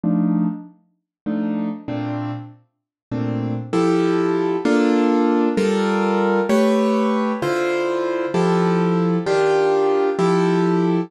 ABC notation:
X:1
M:6/8
L:1/8
Q:3/8=65
K:Cmix
V:1 name="Acoustic Grand Piano"
[F,A,D_E]4 [F,A,DE]2 | [B,,A,CD]4 [B,,A,CD]2 | [K:Fmix] [F,=EGA]3 [B,DFA]3 | [G,FAB]3 [A,G=B^c]3 |
[D,=EFc]3 [F,EGA]3 | [E,DFG]3 [F,=EGA]3 |]